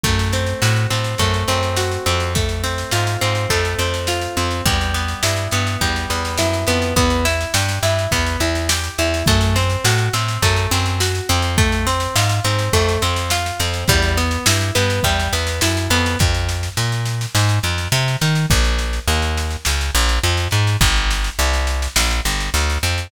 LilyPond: <<
  \new Staff \with { instrumentName = "Acoustic Guitar (steel)" } { \time 4/4 \key e \minor \tempo 4 = 104 a8 c'8 fis'8 c'8 a8 c'8 fis'8 c'8 | a8 c'8 f'8 c'8 a8 c'8 f'8 c'8 | g8 b8 e'8 b8 g8 b8 e'8 b8 | b8 e'8 g'8 e'8 b8 e'8 g'8 e'8 |
a8 c'8 fis'8 c'8 a8 c'8 fis'8 c'8 | a8 c'8 f'8 c'8 a8 c'8 f'8 c'8 | g8 b8 e'8 b8 g8 b8 e'8 b8 | \key f \minor r1 |
r1 | r1 | }
  \new Staff \with { instrumentName = "Electric Bass (finger)" } { \clef bass \time 4/4 \key e \minor fis,4 a,8 a,8 fis,8 fis,4 f,8~ | f,4 gis,8 gis,8 f,8 f,4 f,8 | e,4 g,8 g,8 e,8 e,8 fis,8 f,8 | e,4 g,8 g,8 e,8 e,4 e,8 |
fis,4 a,8 a,8 fis,8 fis,4 f,8~ | f,4 gis,8 gis,8 f,8 f,4 f,8 | e,4 g,8 g,8 e,8 e,8 fis,8 f,8 | \key f \minor f,4 bes,4 aes,8 f,8 c8 ees8 |
bes,,4 ees,4 des,8 bes,,8 f,8 aes,8 | g,,4 c,4 bes,,8 g,,8 d,8 f,8 | }
  \new DrumStaff \with { instrumentName = "Drums" } \drummode { \time 4/4 <bd sn>16 sn16 sn16 sn16 sn16 sn16 sn16 sn16 <bd sn>16 sn16 sn16 sn16 sn16 sn16 sn16 sn16 | <bd sn>16 sn16 sn16 sn16 sn16 sn16 sn16 sn16 <bd sn>16 sn16 sn16 sn16 sn16 sn16 sn16 sn16 | <bd sn>16 sn16 sn16 sn16 sn16 sn16 sn16 sn16 <bd sn>16 sn16 sn16 sn16 sn16 sn16 sn16 sn16 | <bd sn>16 sn16 sn16 sn16 sn16 sn16 sn16 sn16 <bd sn>16 sn16 sn16 sn16 sn16 sn16 sn16 sn16 |
<bd sn>16 sn16 sn16 sn16 sn16 sn16 sn16 sn16 <bd sn>16 sn16 sn16 sn16 sn16 sn16 sn16 sn16 | <bd sn>16 sn16 sn16 sn16 sn16 sn16 sn16 sn16 <bd sn>16 sn16 sn16 sn16 sn16 sn16 sn16 sn16 | <bd sn>16 sn16 sn16 sn16 sn16 sn16 sn16 sn16 <bd sn>16 sn16 sn16 sn16 sn16 sn16 sn16 sn16 | <bd sn>16 sn16 sn16 sn16 sn16 sn16 sn16 sn16 sn16 sn16 sn16 sn16 sn16 sn16 sn16 sn16 |
<bd sn>16 sn16 sn16 sn16 sn16 sn16 sn16 sn16 sn16 sn16 sn16 sn16 sn16 sn16 sn16 sn16 | <bd sn>16 sn16 sn16 sn16 sn16 sn16 sn16 sn16 sn16 sn16 sn16 sn16 sn16 sn16 sn16 sn16 | }
>>